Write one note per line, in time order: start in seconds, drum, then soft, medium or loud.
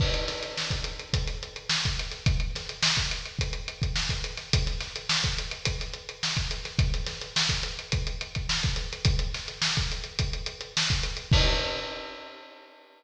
0.00 kick medium
0.00 crash medium
0.14 closed hi-hat medium
0.28 snare medium
0.28 closed hi-hat medium
0.42 snare soft
0.42 closed hi-hat medium
0.57 snare medium
0.71 kick medium
0.71 closed hi-hat medium
0.84 closed hi-hat medium
0.99 closed hi-hat medium
1.13 kick medium
1.13 closed hi-hat medium
1.27 snare soft
1.27 closed hi-hat medium
1.43 closed hi-hat medium
1.56 closed hi-hat medium
1.69 snare loud
1.85 kick medium
1.85 closed hi-hat medium
1.99 closed hi-hat medium
2.11 snare soft
2.11 closed hi-hat medium
2.26 kick loud
2.26 closed hi-hat medium
2.40 closed hi-hat medium
2.55 snare medium
2.55 closed hi-hat medium
2.69 closed hi-hat medium
2.83 snare loud
2.97 kick medium
2.97 closed hi-hat medium
3.11 closed hi-hat medium
3.25 closed hi-hat medium
3.39 kick medium
3.39 closed hi-hat medium
3.53 closed hi-hat medium
3.68 closed hi-hat medium
3.82 kick medium
3.82 closed hi-hat medium
3.96 snare medium
4.09 kick medium
4.09 closed hi-hat medium
4.24 closed hi-hat medium
4.37 snare soft
4.37 closed hi-hat medium
4.53 kick medium
4.53 closed hi-hat loud
4.66 snare soft
4.66 closed hi-hat medium
4.80 snare medium
4.80 closed hi-hat medium
4.96 closed hi-hat medium
5.09 snare loud
5.24 kick medium
5.24 closed hi-hat medium
5.38 closed hi-hat medium
5.51 closed hi-hat medium
5.65 kick medium
5.65 closed hi-hat loud
5.80 snare soft
5.80 closed hi-hat medium
5.94 closed hi-hat medium
6.09 closed hi-hat medium
6.23 snare medium
6.37 kick medium
6.37 closed hi-hat medium
6.51 closed hi-hat medium
6.65 snare soft
6.65 closed hi-hat medium
6.79 kick loud
6.79 closed hi-hat medium
6.93 snare soft
6.93 closed hi-hat medium
7.06 snare medium
7.06 closed hi-hat medium
7.21 closed hi-hat medium
7.36 snare loud
7.49 kick medium
7.49 closed hi-hat medium
7.63 closed hi-hat medium
7.79 closed hi-hat medium
7.92 kick medium
7.92 closed hi-hat medium
8.07 closed hi-hat medium
8.21 closed hi-hat medium
8.35 kick medium
8.35 closed hi-hat medium
8.49 snare medium
8.63 kick medium
8.63 closed hi-hat medium
8.76 closed hi-hat medium
8.92 snare soft
8.92 closed hi-hat medium
9.05 kick loud
9.05 closed hi-hat loud
9.19 closed hi-hat medium
9.34 snare medium
9.34 closed hi-hat medium
9.48 closed hi-hat medium
9.62 snare loud
9.77 kick medium
9.77 closed hi-hat medium
9.92 closed hi-hat medium
10.04 closed hi-hat medium
10.19 kick medium
10.19 closed hi-hat medium
10.33 closed hi-hat medium
10.46 closed hi-hat medium
10.61 closed hi-hat medium
10.77 snare loud
10.90 kick medium
10.90 closed hi-hat medium
11.03 closed hi-hat medium
11.17 closed hi-hat medium
11.31 kick loud
11.31 crash loud